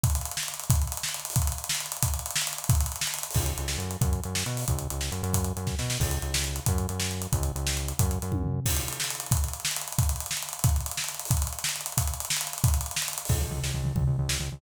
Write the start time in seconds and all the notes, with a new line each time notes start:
0.03 kick, closed hi-hat
0.10 closed hi-hat
0.15 closed hi-hat
0.21 closed hi-hat
0.25 closed hi-hat
0.31 closed hi-hat
0.37 snare
0.43 closed hi-hat
0.48 closed hi-hat
0.54 closed hi-hat
0.59 closed hi-hat
0.64 closed hi-hat
0.70 kick, closed hi-hat
0.75 closed hi-hat
0.82 closed hi-hat
0.87 closed hi-hat
0.92 closed hi-hat
0.97 closed hi-hat
1.03 snare
1.09 closed hi-hat
1.14 closed hi-hat
1.19 closed hi-hat
1.25 closed hi-hat
1.30 open hi-hat
1.36 kick, closed hi-hat
1.42 closed hi-hat
1.47 closed hi-hat
1.52 closed hi-hat
1.58 closed hi-hat
1.64 closed hi-hat
1.69 snare
1.75 closed hi-hat
1.80 closed hi-hat
1.86 closed hi-hat
1.92 closed hi-hat
1.97 closed hi-hat
2.02 kick, closed hi-hat
2.08 closed hi-hat
2.14 closed hi-hat
2.19 closed hi-hat
2.26 closed hi-hat
2.31 closed hi-hat
2.36 snare
2.41 closed hi-hat
2.47 closed hi-hat
2.53 closed hi-hat
2.58 closed hi-hat
2.64 closed hi-hat
2.69 kick, closed hi-hat
2.75 closed hi-hat
2.80 closed hi-hat
2.86 closed hi-hat
2.92 closed hi-hat
2.96 closed hi-hat
3.01 snare
3.07 closed hi-hat
3.14 closed hi-hat
3.18 closed hi-hat
3.23 closed hi-hat
3.31 open hi-hat
3.35 C#2, kick, crash
3.46 closed hi-hat
3.58 C#2, closed hi-hat
3.68 snare
3.78 F#2, closed hi-hat
3.91 closed hi-hat
4.01 F#2, kick, closed hi-hat
4.13 closed hi-hat
4.23 F#2, closed hi-hat
4.35 snare
4.46 B2, closed hi-hat
4.57 open hi-hat
4.68 C#2, kick, closed hi-hat
4.79 closed hi-hat
4.90 C#2, closed hi-hat
5.01 snare
5.12 F#2, closed hi-hat
5.23 F#2, closed hi-hat
5.33 kick, closed hi-hat
5.44 closed hi-hat
5.57 F#2, closed hi-hat
5.67 kick, snare
5.79 B2, snare
5.90 snare
6.00 C#2, kick, crash
6.11 closed hi-hat
6.22 C#2, closed hi-hat
6.34 snare
6.44 closed hi-hat
6.56 closed hi-hat
6.66 F#2, kick, closed hi-hat
6.78 closed hi-hat
6.89 F#2, closed hi-hat
7.00 snare
7.11 closed hi-hat
7.22 closed hi-hat
7.33 C#2, kick, closed hi-hat
7.43 closed hi-hat
7.56 C#2, closed hi-hat
7.67 snare
7.77 closed hi-hat
7.88 closed hi-hat
7.99 F#2, kick, closed hi-hat
8.11 closed hi-hat
8.22 F#2, closed hi-hat
8.32 kick, high tom
8.44 floor tom
8.66 kick, crash
8.71 closed hi-hat
8.76 closed hi-hat
8.81 closed hi-hat
8.88 closed hi-hat
8.93 closed hi-hat
9.00 snare
9.04 closed hi-hat
9.10 closed hi-hat
9.15 closed hi-hat
9.20 closed hi-hat
9.26 closed hi-hat
9.31 kick, closed hi-hat
9.37 closed hi-hat
9.44 closed hi-hat
9.48 closed hi-hat
9.53 closed hi-hat
9.60 closed hi-hat
9.65 snare
9.71 closed hi-hat
9.76 closed hi-hat
9.81 closed hi-hat
9.88 closed hi-hat
9.92 closed hi-hat
9.98 kick, closed hi-hat
10.03 closed hi-hat
10.09 closed hi-hat
10.16 closed hi-hat
10.20 closed hi-hat
10.26 closed hi-hat
10.31 snare
10.37 closed hi-hat
10.42 closed hi-hat
10.49 closed hi-hat
10.53 closed hi-hat
10.59 closed hi-hat
10.64 kick, closed hi-hat
10.69 closed hi-hat
10.76 closed hi-hat
10.80 closed hi-hat
10.86 closed hi-hat
10.91 closed hi-hat
10.97 snare
11.04 closed hi-hat
11.08 closed hi-hat
11.14 closed hi-hat
11.19 closed hi-hat
11.25 open hi-hat
11.31 kick, closed hi-hat
11.37 closed hi-hat
11.42 closed hi-hat
11.47 closed hi-hat
11.53 closed hi-hat
11.59 closed hi-hat
11.64 snare
11.69 closed hi-hat
11.76 closed hi-hat
11.81 closed hi-hat
11.86 closed hi-hat
11.92 closed hi-hat
11.97 kick, closed hi-hat
12.02 closed hi-hat
12.07 closed hi-hat
12.14 closed hi-hat
12.20 closed hi-hat
12.25 closed hi-hat
12.30 snare
12.36 closed hi-hat
12.41 closed hi-hat
12.47 closed hi-hat
12.53 closed hi-hat
12.58 closed hi-hat
12.64 kick, closed hi-hat
12.68 closed hi-hat
12.74 closed hi-hat
12.81 closed hi-hat
12.86 closed hi-hat
12.91 closed hi-hat
12.96 snare
13.02 closed hi-hat
13.08 closed hi-hat
13.13 closed hi-hat
13.18 closed hi-hat
13.25 C#2, open hi-hat
13.29 kick, crash
13.40 C#2, floor tom
13.50 C#2, floor tom
13.63 C#2, snare
13.74 C#2, floor tom
13.83 C#2, floor tom
13.95 C#2, kick, floor tom
14.07 C#2, floor tom
14.18 C#2, floor tom
14.29 C#2, snare
14.39 C#2, floor tom
14.52 C#2, floor tom